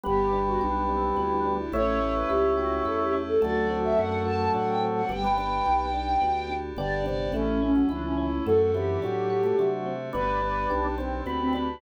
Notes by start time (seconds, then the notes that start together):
0.04 G1 G3 B3 D4 G4
0.33 D4
0.47 F#4
0.61 B1 D4 G4
0.89 C4 D4
1.16 D2 B3 E4
1.31 D4
1.45 D4
1.59 E4
1.72 A1 A3 C#4 E4 G4 C#5
2.01 C#4
2.15 B4
2.29 C#2 E4 G4
2.57 F#4 G4
2.85 E2 E4 A4
2.99 G4
3.13 C#4
3.27 A4
3.41 D2 F#3 A3 C4 D4 F#4 D5
3.70 C4
3.84 E5
3.97 F#2 D4 F#5
4.25 F#4 A5
4.54 A2 D4 F#5
4.68 G5
4.82 C4
4.95 F#5
5.09 G1 G3 B3 D4 G4 G5
5.24 B3
5.38 B3 D4
5.66 B1 G4
5.94 D4
6.21 D2 B3
6.50 D4
6.77 G1 D3 B3 D4 G4 D5
7.06 C3 D5
7.32 A1 E3 A3 C#4 E4
7.62 C#4
7.75 F#3
7.89 C#2 E3 D4 E4
8.04 C#4
8.18 C#4 E4
8.46 F#2 F#3 A3 C4 D4 F#4 A4
8.60 A4
8.74 E3 C4 G4
9.02 A2 F#3 D4
9.30 F#4
9.43 A3
9.58 C3 F#3 D4
9.86 C4
10.13 G1 B3 D4 G4 B4
10.42 D4 B4
10.70 B1 D4 G4
10.98 C4 D4
11.26 D2 B3 C4 B4
11.41 C4
11.53 D4 B4